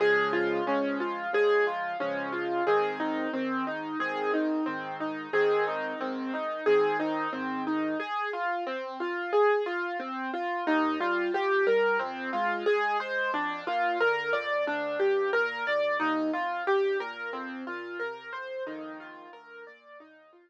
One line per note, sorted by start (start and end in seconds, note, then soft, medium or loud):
0.00 0.60 C#3 medium
0.00 0.60 F3 medium
0.00 0.60 G#3 medium
0.00 0.31 G#4 medium
0.33 0.64 F4 medium
0.67 1.27 C#3 medium
0.67 1.27 F3 medium
0.67 1.27 G#3 medium
0.67 0.98 C#4 medium
1.00 1.31 F4 medium
1.33 1.93 C#3 medium
1.33 1.93 F3 medium
1.33 1.93 G#3 medium
1.33 1.65 G#4 medium
1.67 1.98 F4 medium
2.00 2.60 C#3 medium
2.00 2.60 F3 medium
2.00 2.60 G#3 medium
2.00 2.31 C#4 medium
2.32 2.63 F4 medium
2.67 3.27 G#2 medium
2.67 3.27 D#3 medium
2.67 3.27 C4 medium
2.67 2.97 G#4 medium
3.00 3.31 D#4 medium
3.33 3.94 G#2 medium
3.33 3.94 D#3 medium
3.33 3.64 C4 medium
3.67 3.98 D#4 medium
4.00 4.60 G#2 medium
4.00 4.60 D#3 medium
4.00 4.60 C4 medium
4.00 4.31 G#4 medium
4.34 4.64 D#4 medium
4.66 5.27 G#2 medium
4.66 5.27 D#3 medium
4.66 4.97 C4 medium
5.00 5.31 D#4 medium
5.33 5.93 G#2 medium
5.33 5.93 D#3 medium
5.33 5.93 C4 medium
5.33 5.64 G#4 medium
5.68 5.98 D#4 medium
6.00 6.60 G#2 medium
6.00 6.60 D#3 medium
6.00 6.31 C4 medium
6.34 6.64 D#4 medium
6.66 7.27 G#2 medium
6.66 7.27 D#3 medium
6.66 7.27 C4 medium
6.66 6.97 G#4 medium
7.00 7.30 D#4 medium
7.33 7.94 G#2 medium
7.33 7.94 D#3 medium
7.33 7.63 C4 medium
7.67 7.98 D#4 medium
8.00 8.30 G#4 medium
8.33 8.64 F4 medium
8.67 8.97 C4 medium
9.00 9.31 F4 medium
9.33 9.63 G#4 medium
9.66 9.97 F4 medium
10.00 10.30 C4 medium
10.33 10.64 F4 medium
10.67 10.97 D#2 medium
10.67 10.98 D#4 medium
11.00 11.30 G3 medium
11.00 11.31 F4 medium
11.33 11.63 F3 medium
11.33 11.65 G4 medium
11.67 11.97 G3 medium
11.67 11.98 A#4 medium
11.99 12.30 F2 medium
11.99 12.30 C4 medium
12.33 12.63 G#3 medium
12.33 12.64 F4 medium
12.66 12.97 G#3 medium
12.66 12.97 G#4 medium
13.00 13.30 G#3 medium
13.00 13.31 C5 medium
13.33 13.63 F2 medium
13.33 13.64 D4 medium
13.67 13.97 A#2 medium
13.67 13.98 F4 medium
14.00 14.30 D3 medium
14.00 14.31 A#4 medium
14.33 14.63 F2 medium
14.33 14.63 D5 medium
14.66 14.96 D2 medium
14.66 14.98 D4 medium
14.99 15.30 G2 medium
14.99 15.30 G4 medium
15.33 15.63 A#2 medium
15.33 15.64 A#4 medium
15.67 15.97 D2 medium
15.67 15.98 D5 medium
16.00 16.30 D#2 medium
16.00 16.30 D#4 medium
16.33 16.63 F2 medium
16.33 16.64 F4 medium
16.67 16.97 G2 medium
16.67 16.98 G4 medium
17.00 17.30 A#2 medium
17.00 17.31 A#4 medium
17.33 17.63 F2 medium
17.33 17.64 C4 medium
17.67 17.97 A#2 medium
17.67 17.98 F4 medium
17.99 18.30 C3 medium
17.99 18.30 A#4 medium
18.33 18.64 F2 medium
18.33 18.63 C5 medium
18.67 19.27 A#1 medium
18.67 19.27 F2 medium
18.67 19.27 D#3 medium
18.67 18.97 D#4 medium
19.00 19.31 F4 medium
19.33 19.63 D2 medium
19.33 19.64 A#4 medium
19.67 19.97 A#2 medium
19.67 19.98 D5 medium
20.00 20.30 D#2 medium
20.00 20.31 D#4 medium
20.33 20.50 F2 medium
20.33 20.50 F4 medium